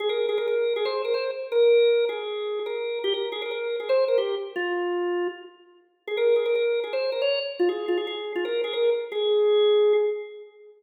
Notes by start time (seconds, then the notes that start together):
0.00 G#4
0.09 A#4
0.29 G#4
0.38 A#4
0.47 A#4
0.76 G#4
0.85 C5
1.05 A#4
1.14 C5
1.52 A#4
2.09 G#4
2.66 A#4
3.04 G4
3.14 A#4
3.32 G#4
3.42 A#4
3.51 A#4
3.80 G#4
3.89 C5
4.08 A#4
4.18 G4
4.56 F4
6.08 G#4
6.17 A#4
6.36 G#4
6.46 A#4
6.55 A#4
6.84 G#4
6.93 C5
7.12 A#4
7.22 C#5
7.59 F4
7.69 G#4
7.88 F4
7.97 G#4
8.07 G#4
8.35 F4
8.45 A#4
8.64 G#4
8.73 A#4
9.12 G#4